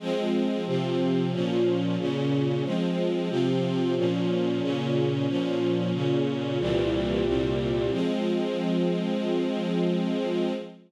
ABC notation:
X:1
M:4/4
L:1/8
Q:1/4=91
K:Fm
V:1 name="String Ensemble 1"
[F,A,C]2 [C,F,C]2 [B,,F,D]2 [B,,D,D]2 | [F,A,C]2 [C,F,C]2 [B,,F,D]2 [B,,D,D]2 | [B,,F,D]2 [B,,D,D]2 [C,,B,,=E,G,]2 [C,,B,,C,G,]2 | [F,A,C]8 |]